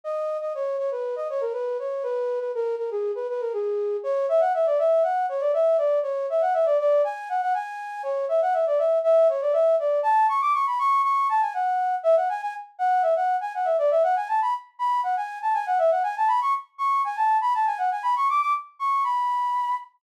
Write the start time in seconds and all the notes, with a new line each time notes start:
0.04 D#5
0.41 D#5
0.55 C#5
0.78 C#5
0.91 B4
1.16 D#5
1.30 C#5
1.41 A#4
1.53 B4
1.79 C#5
2.03 B4
2.40 B4
2.55 A#4
2.78 A#4
2.91 G#4
3.15 B4
3.29 B4
3.41 A#4
3.53 G#4
4.04 C#5
4.29 E5
4.40 F#5
4.54 E5
4.66 D5
4.79 E5
5.03 F#5
5.29 C#5
5.40 D5
5.54 E5
5.78 D5
6.03 C#5
6.30 E5
6.41 F#5
6.54 E5
6.65 D5
6.79 D5
7.04 G#5
7.29 F#5
7.41 F#5
7.54 G#5
8.03 C#5
8.29 E5
8.42 F#5
8.53 E5
8.66 D5
8.78 E5
9.04 E5
9.29 C#5
9.41 D5
9.53 E5
9.79 D5
10.03 A5
10.29 C#6
10.41 D6
10.54 C#6
10.67 B5
10.79 C#6
11.03 C#6
11.29 A5
11.41 G#5
11.54 F#5
12.03 E5
12.16 F#5
12.29 G#5
12.42 G#5
12.79 F#5
13.02 E5
13.16 F#5
13.41 G#5
13.55 F#5
13.65 E5
13.78 D5
13.91 E5
14.03 F#5
14.16 G#5
14.28 A5
14.42 B5
14.79 B5
15.03 F#5
15.17 G#5
15.42 A5
15.54 G#5
15.66 F#5
15.78 E5
15.91 F#5
16.03 G#5
16.17 A5
16.28 B5
16.42 C#6
16.78 C#6
17.04 G#5
17.16 A5
17.41 B5
17.54 A5
17.66 G#5
17.78 F#5
17.91 G#5
18.03 B5
18.16 C#6
18.29 D6
18.41 D6
18.79 C#6
19.04 B5